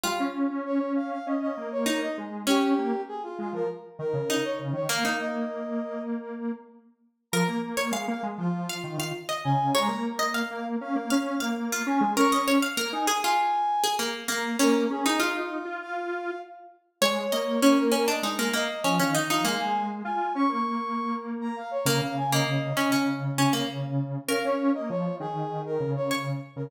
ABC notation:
X:1
M:4/4
L:1/16
Q:1/4=99
K:Bbdor
V:1 name="Brass Section"
f z3 d2 f f e e2 d2 e z2 | G4 A F F B z2 B3 d z d | f2 e6 z8 | b2 z3 f z F5 z2 a2 |
b2 z3 f z f5 z2 a2 | d'2 z3 a z a5 z2 b2 | B2 A2 F F3 f4 z4 | d4 d B B e z2 e3 f z f |
f a2 z a2 d' d'5 z b f d | f2 a e5 z8 | f d2 e d2 A3 B2 d z3 B |]
V:2 name="Harpsichord"
F12 E4 | D12 E4 | B, E9 z6 | B z2 d f2 z3 f2 f z e3 |
d z2 e f2 z3 f2 f z F3 | B e d f B2 A F4 A B,2 B,2 | D3 E F8 z4 | d2 e2 D2 D =D E B, B, z _D D E E |
B,8 z8 | B, z2 B,3 D D3 D B, z4 | B12 d4 |]
V:3 name="Lead 1 (square)"
G, D2 D2 D3 D2 B,4 A,2 | D2 B, z3 A, F, z2 E, D,2 z D, E, | B, B,11 z4 | F, B,2 B, A, B, A, F,3 E, E, z2 D,2 |
A, B,4 B,2 D B, D2 B,3 D A, | D4 B, E z8 B,2 | B,2 D E2 E2 F5 z4 | A,2 B,6 A,2 z2 F, E,2 F, |
A, A,3 F2 D B,9 | D, D,3 D,2 D, D,9 | D D2 B, F,2 E,4 D,4 z D, |]